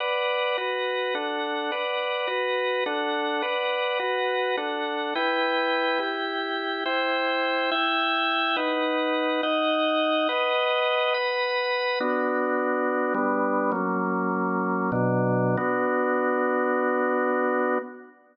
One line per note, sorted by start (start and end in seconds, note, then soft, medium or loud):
0.00 0.57 B4 medium
0.00 0.57 D5 medium
0.00 0.57 F#5 medium
0.58 1.14 F#4 medium
0.58 1.14 B4 medium
0.58 1.14 F#5 medium
1.15 1.71 D4 medium
1.15 1.71 A4 medium
1.15 1.71 F#5 medium
1.72 2.27 B4 medium
1.72 2.28 D5 medium
1.72 2.27 F#5 medium
2.27 2.84 F#4 medium
2.27 2.84 B4 medium
2.27 2.84 F#5 medium
2.86 3.43 D4 medium
2.86 3.43 A4 medium
2.86 3.42 F#5 medium
3.42 3.99 B4 medium
3.42 3.99 D5 medium
3.42 3.99 F#5 medium
3.99 4.56 F#4 medium
3.99 4.56 B4 medium
3.99 4.56 F#5 medium
4.57 5.14 D4 medium
4.57 5.14 A4 medium
4.57 5.14 F#5 medium
5.15 5.99 E4 loud
5.15 6.00 B4 medium
5.15 5.99 G5 loud
5.99 6.84 E4 medium
5.99 6.84 G4 medium
5.99 6.84 G5 medium
6.85 7.70 E4 medium
6.85 7.70 C5 medium
6.85 7.70 G5 loud
7.71 8.56 E4 medium
7.71 8.56 E5 loud
7.71 8.56 G5 loud
8.56 9.41 D#4 medium
8.56 9.41 B4 medium
8.56 9.41 F#5 medium
9.43 10.28 D#4 medium
9.43 10.28 D#5 medium
9.43 10.28 F#5 medium
10.29 11.14 B4 medium
10.29 11.14 D#5 loud
10.29 11.14 F#5 medium
11.14 11.99 B4 medium
11.14 11.99 F#5 medium
11.14 11.99 B5 medium
12.00 13.13 B3 medium
12.00 13.13 D4 medium
12.00 13.13 F#4 medium
13.14 13.71 G3 medium
13.14 13.71 B3 medium
13.14 13.71 D4 loud
13.72 14.91 F#3 medium
13.72 14.91 A#3 medium
13.72 14.91 C#4 medium
14.92 15.56 B2 loud
14.92 15.56 F#3 loud
14.92 15.56 D4 medium
15.57 17.78 B3 medium
15.57 17.78 D4 medium
15.57 17.78 F#4 loud